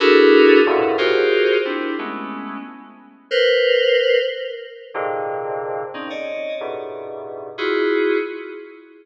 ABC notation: X:1
M:5/8
L:1/16
Q:1/4=91
K:none
V:1 name="Electric Piano 2"
[DE^F^GA^A]4 [E,,^F,,=G,,=A,,^A,,B,,]2 [=F^F=G^GAc]4 | [CDE]2 [^G,A,B,^C]4 z4 | [^ABc]6 z4 | [^G,,^A,,C,D,]6 [C^C^D] [^c=d^d]3 |
[G,,^G,,A,,B,,]6 [EF^F^G]4 |]